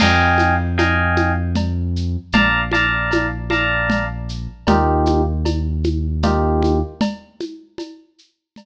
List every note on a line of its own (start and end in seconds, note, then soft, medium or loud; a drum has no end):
0.00 2.17 F2 medium
0.00 0.55 D#5 medium
0.00 0.55 F5 medium
0.00 0.55 G5 medium
0.00 0.55 G#5 medium
0.00 crash loud
0.00 cowbell loud
0.00 low conga loud
0.00 shaker loud
0.38 high conga medium
0.38 shaker medium
0.78 1.32 D#5 medium
0.78 1.32 F5 medium
0.78 1.32 G5 medium
0.78 1.32 G#5 medium
0.78 cowbell medium
0.78 high conga medium
0.78 shaker medium
1.16 high conga medium
1.16 shaker medium
1.55 cowbell medium
1.55 low conga medium
1.55 shaker medium
1.96 shaker medium
2.32 4.48 A#1 medium
2.32 2.61 D5 medium
2.32 2.61 F5 medium
2.32 2.61 A5 medium
2.32 2.61 A#5 medium
2.32 cowbell loud
2.32 low conga loud
2.32 shaker medium
2.71 3.27 D5 medium
2.71 3.27 F5 medium
2.71 3.27 A5 medium
2.71 3.27 A#5 medium
2.71 high conga medium
2.71 shaker medium
3.11 cowbell medium
3.11 high conga loud
3.11 shaker medium
3.50 4.05 D5 medium
3.50 4.05 F5 medium
3.50 4.05 A5 medium
3.50 4.05 A#5 medium
3.50 high conga medium
3.50 shaker medium
3.90 cowbell medium
3.90 low conga loud
3.90 shaker medium
4.29 shaker medium
4.67 6.82 D#2 medium
4.67 5.22 A#3 medium
4.67 5.22 D#4 medium
4.67 5.22 F4 medium
4.67 5.22 G4 medium
4.67 cowbell loud
4.67 low conga loud
4.67 shaker medium
5.06 high conga medium
5.06 shaker medium
5.45 cowbell medium
5.45 high conga medium
5.45 shaker medium
5.84 high conga medium
5.84 shaker medium
6.23 6.78 A#3 medium
6.23 6.78 D#4 medium
6.23 6.78 F4 medium
6.23 6.78 G4 medium
6.23 cowbell medium
6.23 low conga loud
6.23 shaker medium
6.63 high conga medium
6.63 shaker medium
7.01 cowbell loud
7.01 low conga loud
7.01 shaker medium
7.40 high conga medium
7.40 shaker medium
7.78 cowbell medium
7.78 high conga medium
7.78 shaker medium
8.18 shaker medium
8.56 cowbell medium
8.56 low conga medium
8.56 shaker medium